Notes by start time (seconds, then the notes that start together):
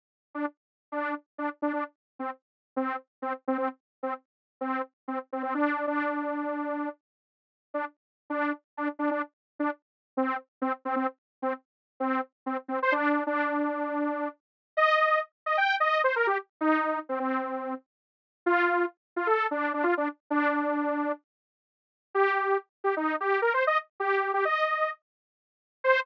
0.35 D4
0.92 D4
1.38 D4
1.62 D4
1.73 D4
2.19 C4
2.76 C4
3.22 C4
3.48 C4
3.58 C4
4.03 C4
4.61 C4
5.08 C4
5.32 C4
5.43 C4
5.54 D4
5.87 D4
7.74 D4
8.30 D4
8.77 D4
8.99 D4
9.11 D4
9.59 D4
10.17 C4
10.62 C4
10.85 C4
10.96 C4
11.42 C4
12.00 C4
12.46 C4
12.68 C4
12.82 C5
12.92 D4
13.27 D4
14.77 D#5
15.46 D#5
15.57 G5
15.80 D#5
16.04 C5
16.16 A#4
16.27 G4
16.61 D#4
17.09 C4
17.19 C4
18.46 F4
19.16 F4
19.27 A4
19.51 D4
19.74 D4
19.83 F4
19.97 D4
20.30 D4
22.15 G4
22.84 G4
22.97 D#4
23.20 G4
23.42 A#4
23.54 C5
23.67 D#5
24.00 G4
24.34 G4
24.45 D#5
25.84 C5